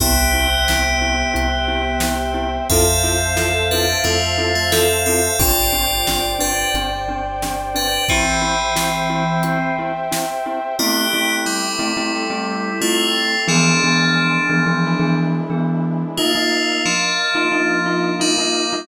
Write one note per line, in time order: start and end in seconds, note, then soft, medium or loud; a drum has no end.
0.00 1.24 C2 loud
0.00 2.51 B3 medium
0.00 0.14 C4 medium
0.00 0.14 E4 medium
0.00 0.14 G4 medium
0.00 2.51 G4 loud
0.00 2.67 C5 medium
0.00 2.67 E5 medium
0.00 2.67 G5 medium
0.00 kick loud
0.00 closed hi-hat loud
0.34 0.47 C4 medium
0.34 0.47 E4 medium
0.34 0.47 G4 medium
0.68 0.83 C4 medium
0.68 0.83 E4 medium
0.68 0.83 G4 medium
0.68 snare loud
1.01 1.15 C4 medium
1.01 1.15 E4 medium
1.01 1.15 G4 medium
1.34 2.59 C2 medium
1.34 1.47 C4 medium
1.34 1.47 E4 medium
1.34 1.47 G4 medium
1.34 closed hi-hat loud
1.68 1.81 C4 medium
1.68 1.81 E4 medium
1.68 1.81 G4 medium
2.00 2.16 C4 medium
2.00 2.16 E4 medium
2.00 2.16 G4 medium
2.00 snare loud
2.34 2.47 C4 medium
2.34 2.47 E4 medium
2.34 2.47 G4 medium
2.69 3.94 F2 loud
2.69 3.63 C4 medium
2.69 2.85 C4 medium
2.69 2.85 E4 medium
2.69 2.85 F4 medium
2.69 3.63 A4 loud
2.69 2.85 A4 medium
2.69 5.36 C5 medium
2.69 5.36 E5 medium
2.69 5.36 F5 medium
2.69 5.36 A5 medium
2.69 kick loud
2.69 closed hi-hat loud
3.03 3.17 C4 medium
3.03 3.17 E4 medium
3.03 3.17 F4 medium
3.03 3.17 A4 medium
3.36 3.50 C4 medium
3.36 3.50 E4 medium
3.36 3.50 F4 medium
3.36 3.50 A4 medium
3.36 snare loud
3.71 3.86 C4 medium
3.71 3.99 D4 medium
3.71 3.86 E4 medium
3.71 3.86 F4 medium
3.71 3.86 A4 medium
3.71 3.99 B4 medium
4.04 5.29 F2 medium
4.04 4.54 A3 medium
4.04 4.17 C4 medium
4.04 4.17 E4 medium
4.04 4.17 F4 medium
4.04 4.54 F4 medium
4.04 4.17 A4 medium
4.04 closed hi-hat loud
4.38 4.51 C4 medium
4.38 4.51 E4 medium
4.38 4.51 F4 medium
4.38 4.51 A4 medium
4.55 4.71 A3 medium
4.55 4.71 F4 medium
4.72 4.85 C4 medium
4.72 5.01 C4 medium
4.72 4.85 E4 medium
4.72 4.85 F4 medium
4.72 4.85 A4 medium
4.72 5.01 A4 loud
4.72 snare loud
5.06 5.37 C4 medium
5.06 5.21 C4 medium
5.06 5.21 E4 medium
5.06 5.21 F4 medium
5.06 5.37 A4 medium
5.06 5.21 A4 medium
5.38 6.63 G1 medium
5.38 5.53 C4 medium
5.38 5.53 D4 medium
5.38 6.31 F4 medium
5.38 5.53 G4 medium
5.38 8.05 C5 medium
5.38 8.05 D5 medium
5.38 6.31 D5 medium
5.38 8.05 G5 medium
5.38 kick loud
5.38 closed hi-hat loud
5.73 5.86 C4 medium
5.73 5.86 D4 medium
5.73 5.86 G4 medium
6.07 6.21 C4 medium
6.07 6.21 D4 medium
6.07 6.21 G4 medium
6.07 snare loud
6.39 6.52 C4 medium
6.39 6.52 D4 medium
6.39 6.71 D4 medium
6.39 6.52 G4 medium
6.39 6.71 B4 medium
6.74 7.98 G1 medium
6.74 6.89 C4 medium
6.74 6.89 D4 medium
6.74 6.89 G4 medium
6.74 closed hi-hat loud
7.08 7.22 C4 medium
7.08 7.22 D4 medium
7.08 7.22 G4 medium
7.42 7.56 C4 medium
7.42 7.56 D4 medium
7.42 7.56 G4 medium
7.42 snare loud
7.74 7.88 C4 medium
7.74 7.88 D4 medium
7.74 8.04 D4 medium
7.74 7.88 G4 medium
7.74 8.04 B4 medium
8.08 9.70 E3 loud
8.08 9.70 C4 loud
8.08 8.24 C4 medium
8.08 8.24 E4 medium
8.08 8.24 G4 medium
8.08 10.76 C5 medium
8.08 10.76 E5 medium
8.08 10.76 G5 medium
8.08 kick loud
8.08 closed hi-hat loud
8.41 8.55 C4 medium
8.41 8.55 E4 medium
8.41 8.55 G4 medium
8.76 8.89 C4 medium
8.76 8.89 E4 medium
8.76 8.89 G4 medium
8.76 snare loud
9.10 9.23 C4 medium
9.10 9.23 E4 medium
9.10 9.23 G4 medium
9.43 9.57 C4 medium
9.43 9.57 E4 medium
9.43 9.57 G4 medium
9.43 closed hi-hat loud
9.79 9.92 C4 medium
9.79 9.92 E4 medium
9.79 9.92 G4 medium
10.11 10.25 C4 medium
10.11 10.25 E4 medium
10.11 10.25 G4 medium
10.11 snare loud
10.46 10.59 C4 medium
10.46 10.59 E4 medium
10.46 10.59 G4 medium
10.79 12.12 A3 medium
10.79 11.06 A3 loud
10.79 11.34 B3 medium
10.79 12.12 C4 medium
10.79 11.06 C4 loud
10.79 12.12 E4 medium
10.79 11.06 E4 loud
10.79 12.12 G4 medium
10.79 11.34 G4 loud
10.79 11.06 G4 loud
11.13 11.67 A3 medium
11.13 11.67 C4 medium
11.13 11.67 E4 medium
11.13 11.67 G4 medium
11.46 12.78 G3 medium
11.46 12.78 E4 medium
11.79 11.93 A3 medium
11.79 11.93 C4 loud
11.79 11.93 E4 loud
11.79 11.93 G4 medium
11.97 12.24 A3 medium
11.97 12.24 C4 medium
11.97 12.24 E4 loud
11.97 12.24 G4 medium
12.14 13.47 A3 medium
12.14 13.47 C4 medium
12.14 13.47 G4 medium
12.14 13.47 A4 medium
12.30 12.71 A3 medium
12.30 12.71 C4 loud
12.30 12.71 E4 medium
12.30 12.71 G4 medium
12.81 13.35 A3 medium
12.81 13.41 A3 medium
12.81 13.35 C4 medium
12.81 13.35 E4 medium
12.81 13.41 F4 loud
12.81 13.35 G4 medium
13.48 13.75 E3 loud
13.48 14.83 E3 medium
13.48 15.12 F3 medium
13.48 14.83 G#3 medium
13.48 13.75 B3 loud
13.48 14.83 B3 medium
13.48 13.75 D4 loud
13.48 15.12 D4 medium
13.48 14.83 D4 medium
13.48 13.75 G#4 loud
13.84 14.37 E3 medium
13.84 14.37 B3 medium
13.84 14.37 D4 medium
13.84 14.37 G#4 loud
14.49 14.63 E3 loud
14.49 14.63 B3 medium
14.49 14.63 D4 medium
14.49 14.63 G#4 medium
14.66 14.93 E3 medium
14.66 14.93 B3 medium
14.66 14.93 D4 medium
14.66 14.93 G#4 medium
14.85 16.18 E3 medium
14.85 16.18 G#3 medium
14.85 16.18 D4 medium
14.85 16.18 E4 medium
15.00 15.40 E3 loud
15.00 15.40 B3 medium
15.00 15.40 D4 medium
15.00 15.40 G#4 medium
15.50 16.04 E3 medium
15.50 16.04 B3 loud
15.50 16.04 D4 medium
15.50 16.04 G#4 medium
16.17 16.82 A3 medium
16.17 16.32 A#3 loud
16.17 16.32 D#4 loud
16.17 16.82 F4 medium
16.17 16.32 F4 loud
16.17 18.84 A#4 medium
16.17 18.84 D#5 medium
16.17 18.84 F5 medium
16.35 16.89 A#3 loud
16.35 16.89 D#4 medium
16.35 16.89 F4 medium
16.86 18.14 F3 medium
16.86 18.14 D4 medium
17.35 17.48 A#3 medium
17.35 17.48 D#4 medium
17.35 17.48 F4 medium
17.52 17.79 A#3 medium
17.52 17.79 D#4 medium
17.52 17.79 F4 medium
17.86 18.13 A#3 medium
17.86 18.13 D#4 medium
17.86 18.13 F4 loud
18.20 18.86 G3 medium
18.20 18.33 A#3 medium
18.20 18.33 D#4 medium
18.20 18.86 D#4 medium
18.20 18.33 F4 loud
18.38 18.65 A#3 medium
18.38 18.65 D#4 medium
18.38 18.65 F4 medium
18.73 18.86 A#3 loud
18.73 18.86 D#4 medium
18.73 18.86 F4 medium